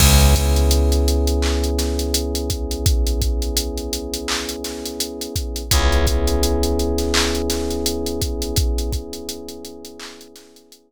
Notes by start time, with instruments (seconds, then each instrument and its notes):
0.00 electric bass (finger) C#2, electric piano 1 B3 C#4 E4 G#4, kick, crash
0.21 closed hi-hat
0.35 kick, closed hi-hat
0.56 closed hi-hat
0.71 closed hi-hat
0.92 closed hi-hat
1.08 closed hi-hat
1.27 closed hi-hat
1.42 clap
1.64 closed hi-hat
1.79 snare, closed hi-hat
1.99 closed hi-hat
2.14 closed hi-hat
2.35 closed hi-hat
2.50 kick, closed hi-hat
2.71 closed hi-hat
2.86 kick, closed hi-hat
3.07 closed hi-hat
3.22 kick, closed hi-hat
3.42 closed hi-hat
3.57 closed hi-hat
3.78 closed hi-hat
3.93 closed hi-hat
4.14 closed hi-hat
4.28 clap
4.49 closed hi-hat
4.64 snare, closed hi-hat
4.86 closed hi-hat
5.00 closed hi-hat
5.21 closed hi-hat
5.36 kick, closed hi-hat
5.56 closed hi-hat
5.71 electric bass (finger) C#2, electric piano 1 B3 C#4 E4 G#4, kick, closed hi-hat
5.92 closed hi-hat
6.07 kick, closed hi-hat
6.27 closed hi-hat
6.43 closed hi-hat
6.63 closed hi-hat
6.79 closed hi-hat
6.98 snare, closed hi-hat
7.14 clap
7.35 closed hi-hat
7.50 snare, closed hi-hat
7.71 closed hi-hat
7.86 closed hi-hat
8.06 closed hi-hat
8.22 kick, closed hi-hat
8.42 closed hi-hat
8.56 kick, closed hi-hat
8.78 closed hi-hat
8.92 kick, closed hi-hat
9.13 closed hi-hat
9.29 closed hi-hat
9.49 closed hi-hat
9.65 closed hi-hat
9.85 closed hi-hat
10.00 clap
10.21 closed hi-hat
10.36 snare, closed hi-hat
10.56 closed hi-hat
10.72 closed hi-hat